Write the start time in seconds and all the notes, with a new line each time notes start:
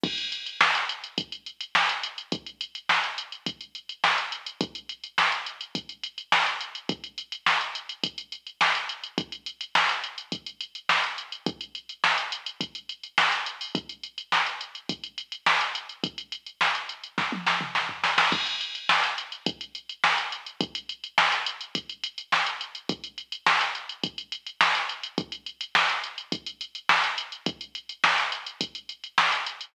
0.03 kick, crash
0.18 closed hi-hat
0.32 closed hi-hat
0.46 closed hi-hat
0.61 snare
0.75 closed hi-hat
0.89 closed hi-hat
1.04 closed hi-hat
1.18 kick, closed hi-hat
1.32 closed hi-hat
1.46 closed hi-hat
1.61 closed hi-hat
1.75 snare
1.89 closed hi-hat
2.03 closed hi-hat
2.18 closed hi-hat
2.32 kick, closed hi-hat
2.46 closed hi-hat
2.61 closed hi-hat
2.75 closed hi-hat
2.89 snare
3.04 closed hi-hat
3.18 closed hi-hat
3.32 closed hi-hat
3.46 kick, closed hi-hat
3.61 closed hi-hat
3.75 closed hi-hat
3.89 closed hi-hat
4.04 snare
4.18 closed hi-hat
4.32 closed hi-hat
4.46 closed hi-hat
4.61 kick, closed hi-hat
4.75 closed hi-hat
4.89 closed hi-hat
5.04 closed hi-hat
5.18 snare
5.32 closed hi-hat
5.46 closed hi-hat
5.61 closed hi-hat
5.75 kick, closed hi-hat
5.89 closed hi-hat
6.03 closed hi-hat
6.18 closed hi-hat
6.32 snare
6.46 closed hi-hat
6.61 closed hi-hat
6.75 closed hi-hat
6.89 kick, closed hi-hat
7.04 closed hi-hat
7.18 closed hi-hat
7.32 closed hi-hat
7.46 snare
7.61 closed hi-hat
7.75 closed hi-hat
7.89 closed hi-hat
8.04 kick, closed hi-hat
8.18 closed hi-hat
8.32 closed hi-hat
8.47 closed hi-hat
8.61 snare
8.75 closed hi-hat
8.89 closed hi-hat
9.04 closed hi-hat
9.18 kick, closed hi-hat
9.32 closed hi-hat
9.46 closed hi-hat
9.61 closed hi-hat
9.75 snare
9.89 closed hi-hat
10.04 closed hi-hat
10.18 closed hi-hat
10.32 kick, closed hi-hat
10.46 closed hi-hat
10.61 closed hi-hat
10.75 closed hi-hat
10.89 snare
11.04 closed hi-hat
11.18 closed hi-hat
11.32 closed hi-hat
11.46 kick, closed hi-hat
11.61 closed hi-hat
11.75 closed hi-hat
11.89 closed hi-hat
12.04 snare
12.18 closed hi-hat
12.32 closed hi-hat
12.46 closed hi-hat
12.61 kick, closed hi-hat
12.75 closed hi-hat
12.89 closed hi-hat
13.03 closed hi-hat
13.18 snare
13.32 closed hi-hat
13.46 closed hi-hat
13.61 open hi-hat
13.75 kick, closed hi-hat
13.89 closed hi-hat
14.03 closed hi-hat
14.18 closed hi-hat
14.32 snare
14.46 closed hi-hat
14.61 closed hi-hat
14.75 closed hi-hat
14.89 kick, closed hi-hat
15.04 closed hi-hat
15.18 closed hi-hat
15.32 closed hi-hat
15.46 snare
15.61 closed hi-hat
15.75 closed hi-hat
15.89 closed hi-hat
16.04 kick, closed hi-hat
16.18 closed hi-hat
16.32 closed hi-hat
16.46 closed hi-hat
16.61 snare
16.75 closed hi-hat
16.89 closed hi-hat
17.04 closed hi-hat
17.18 kick, snare
17.32 high tom
17.47 snare
17.61 mid tom
17.75 snare
17.89 floor tom
18.04 snare
18.18 snare
18.32 kick, crash
18.46 closed hi-hat
18.61 closed hi-hat
18.75 closed hi-hat
18.89 snare
19.04 closed hi-hat
19.18 closed hi-hat
19.32 closed hi-hat
19.46 kick, closed hi-hat
19.61 closed hi-hat
19.75 closed hi-hat
19.89 closed hi-hat
20.04 snare
20.18 closed hi-hat
20.32 closed hi-hat
20.46 closed hi-hat
20.61 kick, closed hi-hat
20.75 closed hi-hat
20.89 closed hi-hat
21.04 closed hi-hat
21.18 snare
21.32 closed hi-hat
21.46 closed hi-hat
21.61 closed hi-hat
21.75 kick, closed hi-hat
21.89 closed hi-hat
22.04 closed hi-hat
22.18 closed hi-hat
22.32 snare
22.46 closed hi-hat
22.61 closed hi-hat
22.75 closed hi-hat
22.89 kick, closed hi-hat
23.04 closed hi-hat
23.18 closed hi-hat
23.32 closed hi-hat
23.46 snare
23.61 closed hi-hat
23.75 closed hi-hat
23.89 closed hi-hat
24.03 kick, closed hi-hat
24.18 closed hi-hat
24.32 closed hi-hat
24.47 closed hi-hat
24.61 snare
24.75 closed hi-hat
24.89 closed hi-hat
25.03 closed hi-hat
25.18 kick, closed hi-hat
25.32 closed hi-hat
25.46 closed hi-hat
25.61 closed hi-hat
25.75 snare
25.89 closed hi-hat
26.04 closed hi-hat
26.18 closed hi-hat
26.32 kick, closed hi-hat
26.46 closed hi-hat
26.61 closed hi-hat
26.75 closed hi-hat
26.89 snare
27.04 closed hi-hat
27.18 closed hi-hat
27.32 closed hi-hat
27.46 kick, closed hi-hat
27.61 closed hi-hat
27.75 closed hi-hat
27.89 closed hi-hat
28.04 snare
28.18 closed hi-hat
28.32 closed hi-hat
28.47 closed hi-hat
28.61 kick, closed hi-hat
28.75 closed hi-hat
28.89 closed hi-hat
29.04 closed hi-hat
29.18 snare
29.32 closed hi-hat
29.46 closed hi-hat
29.61 closed hi-hat